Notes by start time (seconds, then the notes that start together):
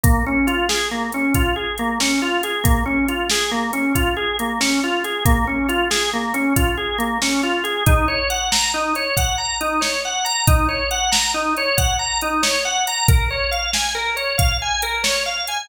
0.04 A#3, kick, closed hi-hat
0.26 C#4
0.47 F4, closed hi-hat
0.69 G#4, snare
0.91 A#3
1.12 C#4, closed hi-hat
1.34 F4, kick, closed hi-hat
1.56 G#4
1.78 A#3, closed hi-hat
2.00 C#4, snare
2.22 F4
2.43 G#4, closed hi-hat
2.64 A#3, kick, closed hi-hat
2.86 C#4
3.08 F4, closed hi-hat
3.30 G#4, snare
3.51 A#3
3.73 C#4, closed hi-hat
3.95 F4, kick, closed hi-hat
4.17 G#4
4.39 A#3, closed hi-hat
4.61 C#4, snare
4.84 F4
5.04 G#4, closed hi-hat
5.25 A#3, kick, closed hi-hat
5.47 C#4
5.69 F4, closed hi-hat
5.90 G#4, snare
6.13 A#3
6.34 C#4, closed hi-hat
6.56 F4, kick, closed hi-hat
6.77 G#4
6.98 A#3, closed hi-hat
7.22 C#4, snare
7.43 F4
7.64 G#4, closed hi-hat
7.86 D#4, kick, closed hi-hat
8.08 C#5
8.30 F#5, closed hi-hat
8.52 A#5, snare
8.74 D#4
8.95 C#5, closed hi-hat
9.17 F#5, kick, closed hi-hat
9.38 A#5
9.61 D#4, closed hi-hat
9.81 C#5, snare
10.05 F#5
10.25 A#5, closed hi-hat
10.47 D#4, kick, closed hi-hat
10.69 C#5
10.91 F#5, closed hi-hat
11.12 A#5, snare
11.34 D#4
11.57 C#5, closed hi-hat
11.78 F#5, kick, closed hi-hat
11.99 A#5
12.21 D#4, closed hi-hat
12.43 C#5, snare
12.65 F#5
12.87 A#5, closed hi-hat
13.08 A#4, kick, closed hi-hat
13.31 C#5
13.51 F5, closed hi-hat
13.73 G#5, snare
13.95 A#4
14.16 C#5, closed hi-hat
14.38 F5, kick, closed hi-hat
14.62 G#5
14.82 A#4, closed hi-hat
15.04 C#5, snare
15.26 F5
15.47 G#5, closed hi-hat